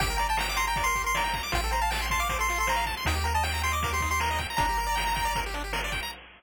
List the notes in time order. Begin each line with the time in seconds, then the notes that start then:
0.00 G1 G4 G5, kick, closed hi-hat
0.10 A#4
0.18 D5 A#5, closed hi-hat
0.29 G5 A5
0.37 G5 A#5, snare
0.49 D6
0.56 A#5 C6, closed hi-hat
0.67 G5 A#5
0.76 D5, kick, closed hi-hat
0.84 A#4 C6
0.95 G4, kick, closed hi-hat
1.04 A#4 C6
1.14 D5 A#5, snare
1.24 G5
1.33 A#5, kick, closed hi-hat
1.43 D6
1.52 A1 F4 G5, kick, closed hi-hat
1.63 A4
1.71 C5 A#5, closed hi-hat
1.81 F5 A5
1.91 G5 A5, snare
2.01 C6
2.10 A5 C6, kick, closed hi-hat
2.20 F5 D6
2.29 C5, kick, closed hi-hat
2.39 A4 C6
2.48 F4, closed hi-hat
2.58 A4 C6
2.67 C5 A#5, snare
2.76 F5
2.86 A5, kick, closed hi-hat
2.97 C6
3.05 D#2 D#4 G5, kick, closed hi-hat
3.15 G4
3.24 A#4 A#5, closed hi-hat
3.34 D#5 A5
3.43 G5, snare
3.54 A#5
3.63 G5 C6, closed hi-hat
3.72 D#5 D6
3.83 A#4, kick, closed hi-hat
3.92 G4 C6
4.00 D#4, kick, closed hi-hat
4.11 G4 C6
4.20 A#4 A#5, snare
4.31 D#5
4.38 G5, kick, closed hi-hat
4.50 A#5
4.57 G1 D4 A#5, kick, closed hi-hat
4.69 G4
4.78 A#4, closed hi-hat
4.86 D5
4.95 G5, snare
5.07 A#5
5.15 G5, kick, closed hi-hat
5.25 D5
5.35 A#4, kick, closed hi-hat
5.46 G4
5.54 D4, closed hi-hat
5.64 G4
5.73 A#4, snare
5.84 D5
5.92 G5, kick, closed hi-hat
6.03 A#5